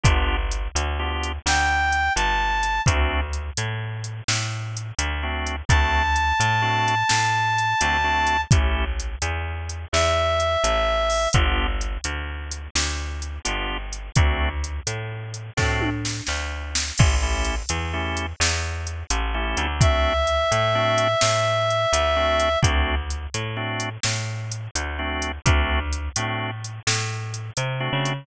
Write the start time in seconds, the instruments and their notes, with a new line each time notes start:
0.04 electric bass (finger) G1, drawbar organ B3 D4 F4 G4, kick, closed hi-hat
0.51 closed hi-hat
0.75 electric bass (finger) D2, closed hi-hat
0.99 drawbar organ B3 D4 F4 G4
1.24 closed hi-hat
1.46 electric bass (finger) D2, clarinet G5, snare
1.92 closed hi-hat
2.15 electric bass (finger) G1, clarinet A5, closed hi-hat
2.63 closed hi-hat
2.86 electric bass (finger) D2, drawbar organ A3 C4 D4 F#4, kick, closed hi-hat
3.33 closed hi-hat
3.57 electric bass (finger) A2, closed hi-hat
4.04 closed hi-hat
4.28 electric bass (finger) A2, snare
4.77 closed hi-hat
4.99 electric bass (finger) D2, closed hi-hat
5.23 drawbar organ A3 C4 D4 F#4
5.47 closed hi-hat
5.69 electric bass (finger) D2, drawbar organ A3 C4 D4 F#4, clarinet A5, kick, closed hi-hat
6.16 closed hi-hat
6.40 electric bass (finger) A2, closed hi-hat
6.62 drawbar organ A3 C4 D4 F#4
6.88 closed hi-hat
7.09 electric bass (finger) A2, snare
7.58 closed hi-hat
7.81 electric bass (finger) D2, drawbar organ A3 C4 D4 F#4, closed hi-hat
8.04 drawbar organ A3 C4 D4 F#4
8.27 closed hi-hat
8.51 electric bass (finger) A1, drawbar organ A3 C#4 E4 G4, kick, closed hi-hat
9.00 closed hi-hat
9.22 electric bass (finger) E2, closed hi-hat
9.69 closed hi-hat
9.93 electric bass (finger) E2, clarinet E5, snare
10.40 closed hi-hat
10.64 electric bass (finger) A1, closed hi-hat
11.10 open hi-hat
11.33 electric bass (finger) G1, drawbar organ B3 D4 F4 G4, kick, closed hi-hat
11.81 closed hi-hat
12.04 electric bass (finger) D2, closed hi-hat
12.51 closed hi-hat
12.75 electric bass (finger) D2, snare
13.22 closed hi-hat
13.45 electric bass (finger) G1, drawbar organ B3 D4 F4 G4, closed hi-hat
13.93 closed hi-hat
14.16 electric bass (finger) D2, drawbar organ A3 C4 D4 F#4, kick, closed hi-hat
14.64 closed hi-hat
14.87 electric bass (finger) A2, closed hi-hat
15.34 closed hi-hat
15.57 electric bass (finger) A2, drawbar organ A3 C4 D4 F#4, kick, snare
15.81 high tom
16.05 snare
16.27 electric bass (finger) D2, snare
16.75 snare
16.98 electric bass (finger) A1, drawbar organ A3 C#4 E4 G4, kick, crash
17.22 drawbar organ A3 C#4 E4 G4
17.45 closed hi-hat
17.69 electric bass (finger) E2, closed hi-hat
17.94 drawbar organ A3 C#4 E4 G4
18.17 closed hi-hat
18.40 electric bass (finger) E2, snare
18.87 closed hi-hat
19.10 electric bass (finger) A1, closed hi-hat
19.34 drawbar organ A3 C#4 E4 G4
19.57 electric bass (finger) D2, closed hi-hat
19.80 drawbar organ A3 C4 D4 F#4, clarinet E5, kick, closed hi-hat
20.27 closed hi-hat
20.52 electric bass (finger) A2, closed hi-hat
20.75 drawbar organ A3 C4 D4 F#4
20.98 closed hi-hat
21.21 electric bass (finger) A2, snare
21.70 closed hi-hat
21.93 electric bass (finger) D2, closed hi-hat
22.16 drawbar organ A3 C4 D4 F#4
22.40 closed hi-hat
22.62 electric bass (finger) D2, drawbar organ A3 C4 D4 F#4, kick, closed hi-hat
23.10 closed hi-hat
23.34 electric bass (finger) A2, closed hi-hat
23.57 drawbar organ A3 C4 D4 F#4
23.80 closed hi-hat
24.03 electric bass (finger) A2, snare
24.51 closed hi-hat
24.75 electric bass (finger) D2, closed hi-hat
24.99 drawbar organ A3 C4 D4 F#4
25.22 closed hi-hat
25.46 electric bass (finger) D2, drawbar organ A3 C4 D4 F#4, kick, closed hi-hat
25.93 closed hi-hat
26.16 electric bass (finger) A2, drawbar organ A3 C4 D4 F#4, closed hi-hat
26.64 closed hi-hat
26.87 electric bass (finger) A2, snare
27.34 closed hi-hat
27.57 electric bass (finger) C3, closed hi-hat
27.80 drawbar organ A3 C4 D4 F#4
27.93 electric bass (finger) C#3
28.05 closed hi-hat